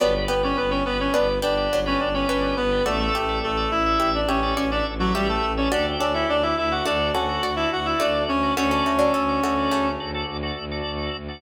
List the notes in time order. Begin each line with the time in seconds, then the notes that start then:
0.00 G1 F#3 B3 D4 G4 B4 D5
0.28 G1 B3 G4 B4
0.43 C#4 G4 B4 C#5 D5
0.57 G1 B3 B4
0.70 C#4 G4 B4 C#5 D5
0.84 G1 B3 G4 B4 D5
1.00 C#4 G4 B4 C#5 D5
1.13 G1 B3 D4 B4
1.42 G1 B3 D4 G4 B4 D5
1.57 G4 B4 D5
1.71 G1 F#3 D4
1.86 C#4 G4 B4 C#5 D5
2.00 G1 D4 D5
2.14 C#4 G4 B4 C#5 D5
2.28 G1 C#4 D4 B4 C#5
2.56 G1 B3 B4
2.71 G4 B4 D5
2.85 A1 A3 F#4 A4 D5 E5
2.99 A3 A4
3.15 A1 G4 E5
3.29 A4 D5 E5
3.42 A1 A3 A4
3.57 A4 D5 E5
3.71 A1 E4 A4 D5 E5
3.86 A4 D5 E5
4.00 A1 G4 E5
4.15 D4 D5
4.28 A1 C#4 G4 A4 C#5 D5 E5
4.43 A4 D5 E5
4.56 A1 C#4 F#4 C#5 D5
4.71 D4 A4 D5 E5
4.87 A1
4.99 F#3 F#4 A4 D5 E5
5.14 A1 G3 G4 E5
5.29 A3 A4
5.43 A1
5.57 C#4 A4 C#5 D5 E5
5.71 D2 D4 F#4 G4 A4 D5
5.99 D2 C#4 D4 A4 D5
6.14 E4 G4 A4 D5 E5
6.29 D2 D4 D5
6.43 E4 G4 A4 D5 E5
6.57 D2 E4 G4 A4 D5 E5
6.71 F#4 G4 A4 D5 F#5
6.85 D2 A3 D4 F#4 A4 D5
7.13 D2 C#4 F#4 A4 D5 F#5
7.29 F#4 A4 D5
7.41 D2 F#4 D5
7.56 E4 F#4 A4 D5 E5
7.70 D2 F#4 F#5
7.86 E4 F#4 A4 D5 E5
8.00 D2 A3 D4 F#4 D5
8.28 D2 C#4 C#5
8.43 F#4 A4 D5
8.57 D2 A3 C#4 F#4 A4 C#5 D5
8.71 C#4 A4
8.86 D2 A3 F#4
8.99 F#3 D4 F#4 A4 D5
9.14 D2 C#4 A4
9.29 F#4 A4 D5
9.43 D2 A3 F#4 A4 D5
9.57 F#4 A4 D5
9.71 D2 C#3 A3
10.00 D2 F#4 A4 D5
10.14 F#4 A4 D5
10.27 D2
10.43 F#4 A4 D5
10.57 D2
10.71 F#4 A4 D5
10.85 D2
11.15 D2
11.28 F#4 A4 D5